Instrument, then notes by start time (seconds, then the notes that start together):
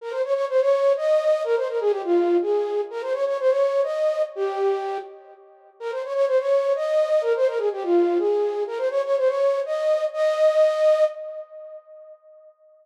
flute
0.01 A#4
0.10 C5
0.24 C#5
0.34 C#5
0.49 C5
0.61 C#5
0.97 D#5
1.44 A#4
1.56 C5
1.68 A#4
1.80 G#4
1.91 G4
2.04 F4
2.42 G#4
2.91 A#4
3.02 C5
3.13 C#5
3.26 C#5
3.39 C5
3.49 C#5
3.83 D#5
4.35 G4
5.80 A#4
5.91 C5
6.05 C#5
6.14 C#5
6.27 C5
6.39 C#5
6.75 D#5
7.21 A#4
7.36 C5
7.47 A#4
7.58 G#4
7.72 G4
7.83 F4
8.18 G#4
8.67 A#4
8.77 C5
8.90 C#5
9.04 C#5
9.17 C5
9.27 C#5
9.66 D#5
10.13 D#5